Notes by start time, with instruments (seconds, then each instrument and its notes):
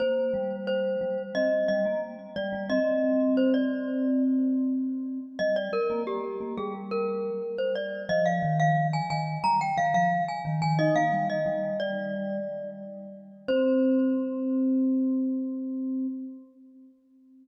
0.00 vibraphone A#3, glockenspiel C5
0.34 vibraphone G3
0.67 glockenspiel C5
1.01 vibraphone G3
1.35 vibraphone C4, glockenspiel D#5
1.68 vibraphone G3, glockenspiel D#5
1.85 vibraphone A#3
2.36 vibraphone G3, glockenspiel D5
2.53 vibraphone G3
2.70 vibraphone C4, glockenspiel D#5
3.37 glockenspiel C5
3.54 glockenspiel D5
5.39 vibraphone G3, glockenspiel D#5
5.56 glockenspiel D5
5.73 glockenspiel A#4
5.90 vibraphone A#3
6.07 glockenspiel G4
6.40 vibraphone A#3
6.57 vibraphone G3, glockenspiel G#4
6.91 glockenspiel A#4
7.58 glockenspiel C5
7.75 glockenspiel D5
8.09 vibraphone F3, glockenspiel D#5
8.26 glockenspiel F5
8.43 vibraphone D#3
8.60 glockenspiel F5
8.93 glockenspiel G#5
9.10 vibraphone D#3, glockenspiel G#5
9.44 vibraphone G3, glockenspiel A#5
9.61 glockenspiel G5
9.77 vibraphone D#3, glockenspiel F5
9.94 vibraphone F3, glockenspiel F5
10.28 glockenspiel G#5
10.45 vibraphone D#3
10.62 vibraphone D#3, glockenspiel G#5
10.79 vibraphone D#4, glockenspiel D#5
10.96 vibraphone A#3, glockenspiel F5
11.12 vibraphone G3
11.30 glockenspiel D#5
11.46 vibraphone G3
11.80 glockenspiel D5
13.48 vibraphone C4, glockenspiel C5